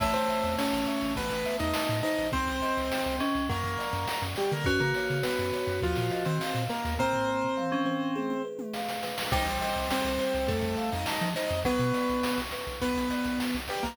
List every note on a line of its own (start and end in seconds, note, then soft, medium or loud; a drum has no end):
0.00 0.13 A1 medium
0.00 2.01 A3 loud
0.00 0.13 E4 medium
0.00 1.11 C#5 medium
0.00 0.13 E5 medium
0.00 kick medium
0.00 snare medium
0.00 crash medium
0.14 0.28 A1 medium
0.14 0.55 C4 medium
0.14 0.55 C5 medium
0.14 snare medium
0.29 0.87 E5 medium
0.29 snare medium
0.44 0.57 E2 medium
0.44 snare medium
0.58 1.13 C#4 medium
0.58 1.13 C#5 medium
0.58 1.14 A5 medium
0.58 snare medium
0.73 0.86 A1 medium
0.73 snare medium
0.86 1.15 E5 medium
0.86 snare medium
1.01 1.15 A1 medium
1.01 snare medium
1.16 1.30 A1 medium
1.16 1.57 B3 medium
1.16 2.27 B4 medium
1.16 1.57 B4 loud
1.16 kick medium
1.16 snare medium
1.30 1.44 A1 medium
1.30 snare medium
1.45 2.29 E5 medium
1.45 snare medium
1.59 1.73 E2 medium
1.59 1.99 D#4 medium
1.59 1.99 D#5 medium
1.59 snare medium
1.74 2.30 A5 medium
1.74 snare loud
1.89 2.02 A2 medium
1.89 snare medium
2.03 2.28 D#4 medium
2.03 3.44 C5 medium
2.03 2.28 D#5 medium
2.03 snare medium
2.18 2.32 A1 medium
2.18 snare medium
2.32 2.47 C2 medium
2.32 3.16 C4 medium
2.32 3.18 C4 medium
2.32 3.16 C5 loud
2.32 kick medium
2.32 snare medium
2.48 2.61 C2 medium
2.48 snare medium
2.62 3.20 D#5 medium
2.62 snare medium
2.77 2.90 C2 medium
2.77 snare medium
2.91 3.47 G5 medium
2.91 snare medium
3.06 3.19 C2 medium
3.06 snare soft
3.20 3.44 C#4 medium
3.20 3.48 D#5 medium
3.20 snare medium
3.35 3.48 C2 medium
3.35 snare medium
3.49 3.63 F#2 medium
3.49 4.48 F#3 medium
3.49 4.23 A#3 medium
3.49 4.23 A#4 medium
3.49 4.60 A#4 medium
3.49 kick medium
3.49 snare medium
3.63 3.77 F#2 medium
3.63 snare medium
3.79 4.36 D5 medium
3.79 snare medium
3.93 4.06 F#2 medium
3.93 snare medium
4.07 4.63 F#5 medium
4.07 snare medium
4.22 4.35 F#2 medium
4.22 snare medium
4.36 4.51 G3 medium
4.36 4.51 G4 medium
4.36 4.65 D5 medium
4.36 snare medium
4.51 4.65 D3 medium
4.51 4.66 A#3 medium
4.51 4.66 A#4 medium
4.51 snare soft
4.64 4.79 F#2 medium
4.64 4.80 C#4 medium
4.64 6.53 F#4 loud
4.64 5.77 B4 medium
4.64 4.80 C#5 loud
4.64 kick medium
4.64 snare medium
4.80 4.94 C#3 medium
4.80 5.18 A#3 medium
4.80 5.18 A#4 medium
4.80 snare medium
4.94 5.53 C#5 medium
4.94 snare medium
5.10 5.23 C#3 medium
5.10 snare medium
5.23 5.80 B3 medium
5.23 5.80 B4 medium
5.23 5.80 F#5 medium
5.23 snare medium
5.39 5.52 F#2 medium
5.39 snare medium
5.53 5.81 C#5 medium
5.53 snare medium
5.67 5.80 F#2 medium
5.67 snare medium
5.82 5.95 D#2 medium
5.82 6.23 F3 medium
5.82 6.23 F4 loud
5.82 6.69 A#4 medium
5.82 kick medium
5.82 snare medium
5.96 6.11 A#2 medium
5.96 snare medium
6.10 6.95 D#5 medium
6.10 snare medium
6.25 6.39 D#3 medium
6.25 6.63 C4 medium
6.25 6.63 C5 medium
6.25 snare medium
6.41 6.96 F5 medium
6.41 snare medium
6.55 6.68 A#2 medium
6.55 snare medium
6.70 6.94 A#3 medium
6.70 6.94 A#4 medium
6.70 8.10 A#4 medium
6.70 snare medium
6.85 6.98 D#2 medium
6.85 snare medium
6.99 7.47 A#3 medium
6.99 8.42 C4 medium
6.99 8.42 C5 loud
6.99 kick medium
6.99 floor tom medium
7.13 floor tom medium
7.28 7.86 C5 medium
7.44 floor tom medium
7.57 8.13 F5 medium
7.57 mid tom medium
7.72 8.13 C#4 medium
7.72 mid tom medium
7.85 8.14 C5 medium
7.85 mid tom medium
8.15 9.26 G#4 medium
8.15 high tom medium
8.30 high tom medium
8.45 9.02 B4 medium
8.59 high tom medium
8.74 9.29 F5 medium
8.74 snare medium
8.89 snare medium
9.03 9.31 B4 medium
9.03 snare medium
9.18 snare medium
9.31 9.45 C2 medium
9.31 11.58 G3 medium
9.31 9.46 D#4 medium
9.31 9.58 C5 medium
9.31 9.46 D#5 loud
9.31 kick loud
9.31 snare medium
9.31 crash medium
9.46 9.59 C2 medium
9.46 9.88 C4 medium
9.46 9.88 C5 medium
9.46 snare medium
9.61 9.87 D#5 medium
9.61 snare medium
9.76 9.89 C2 medium
9.76 snare medium
9.90 10.48 C4 medium
9.90 10.48 C5 medium
9.90 10.17 G5 medium
9.90 snare medium
10.04 10.18 C2 medium
10.04 snare medium
10.19 10.46 C5 medium
10.19 snare medium
10.34 10.47 C2 medium
10.34 snare medium
10.48 10.62 F2 medium
10.48 10.90 A3 medium
10.48 10.90 A4 medium
10.48 10.75 C5 loud
10.48 kick medium
10.48 snare medium
10.61 10.76 F2 medium
10.61 snare medium
10.77 11.04 F5 medium
10.77 snare medium
10.92 11.06 F2 medium
10.92 11.29 D#4 medium
10.92 11.29 D#5 medium
10.92 snare medium
11.06 11.33 A5 medium
11.06 snare medium
11.21 11.34 F3 medium
11.21 snare medium
11.36 11.60 D#4 medium
11.36 11.62 C5 medium
11.36 11.60 D#5 medium
11.36 snare medium
11.49 11.64 F2 medium
11.49 snare medium
11.64 11.78 B1 medium
11.64 13.77 F#3 loud
11.64 12.40 B3 medium
11.64 11.91 B4 medium
11.64 12.40 B4 loud
11.64 kick medium
11.64 snare medium
11.79 11.92 B2 medium
11.79 snare medium
11.94 12.20 D5 medium
11.94 snare medium
12.09 12.23 B1 medium
12.09 snare medium
12.23 12.50 F#5 medium
12.23 snare loud
12.37 12.51 B1 medium
12.37 snare medium
12.51 12.79 B4 medium
12.51 snare medium
12.67 12.80 B1 medium
12.67 snare soft
12.81 12.95 B1 medium
12.81 13.56 B3 medium
12.81 13.56 B4 medium
12.81 13.08 B4 medium
12.81 kick medium
12.81 snare medium
12.96 13.09 B1 medium
12.96 snare medium
13.10 13.37 D5 medium
13.10 snare medium
13.24 13.39 B1 medium
13.24 snare medium
13.40 13.66 F#5 medium
13.40 snare medium
13.54 13.68 B1 medium
13.54 snare medium
13.68 13.84 G3 medium
13.68 13.84 G4 medium
13.68 13.95 B4 medium
13.68 snare medium
13.83 13.97 B1 medium
13.83 13.97 A#3 medium
13.83 13.97 A#4 medium
13.83 snare medium